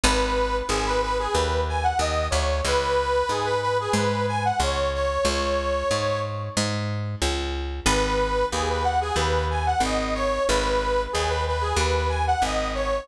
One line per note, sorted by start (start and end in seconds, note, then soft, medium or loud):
0.03 0.62 G#1 medium
0.03 0.56 B4 loud
0.69 1.28 G#1 medium
0.69 0.85 G#4 loud
0.86 1.01 B4 loud
1.02 1.17 B4 loud
1.19 1.35 G#4 loud
1.33 1.93 D#2 medium
1.33 1.61 B4 medium
1.69 1.84 G#5 loud
1.83 1.99 F#5 medium
1.99 2.28 D#2 medium
1.99 2.27 D#5 loud
2.30 2.61 D2 medium
2.30 2.59 C#5 medium
2.65 3.23 C#2 medium
2.65 3.29 B4 loud
3.29 3.88 G#2 medium
3.29 3.46 G#4 loud
3.45 3.61 B4 loud
3.62 3.78 B4 loud
3.80 3.96 G#4 loud
3.93 4.52 G#2 medium
3.93 4.26 B4 loud
4.28 4.43 G#5 loud
4.45 4.60 F#5 medium
4.60 5.18 C#2 medium
4.60 4.90 C#5 loud
4.94 5.26 C#5 loud
5.25 5.83 C#2 medium
5.25 6.19 C#5 loud
5.91 6.49 G#2 medium
6.57 7.15 G#2 medium
7.22 7.80 C#2 medium
7.86 8.44 G#1 medium
7.86 8.45 B4 loud
8.52 9.11 D#2 medium
8.52 8.68 G#4 loud
8.69 8.85 B4 medium
8.84 9.00 F#5 loud
9.01 9.16 G#4 loud
9.16 9.74 D#2 medium
9.16 9.45 B4 loud
9.50 9.66 G#5 loud
9.66 9.82 F#5 loud
9.80 10.39 G#1 medium
9.80 10.14 D#5 loud
10.15 10.44 C#5 loud
10.48 11.07 G#1 medium
10.48 11.02 B4 loud
11.13 11.73 D#2 medium
11.13 11.28 G#4 loud
11.29 11.44 B4 loud
11.47 11.63 B4 medium
11.61 11.77 G#4 loud
11.76 12.35 D#2 medium
11.76 12.09 B4 loud
12.09 12.25 G#5 loud
12.27 12.43 F#5 loud
12.42 13.00 G#1 medium
12.42 12.71 D#5 loud
12.75 13.04 C#5 loud